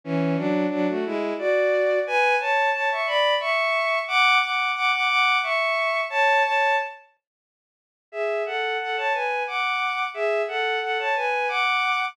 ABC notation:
X:1
M:3/4
L:1/16
Q:1/4=89
K:A
V:1 name="Violin"
[E,C]2 [F,D]2 [F,D] [A,F] [G,E]2 [Fd]4 | [Bg]2 [ca]2 [ca] [ec'] [db]2 [ec']4 | [fd']2 [fd']2 [fd'] [fd'] [fd']2 [ec']4 | [ca]2 [ca]2 z8 |
[Ge]2 [Af]2 [Af] [ca] [Bg]2 [fd']4 | [Ge]2 [Af]2 [Af] [ca] [Bg]2 [fd']4 |]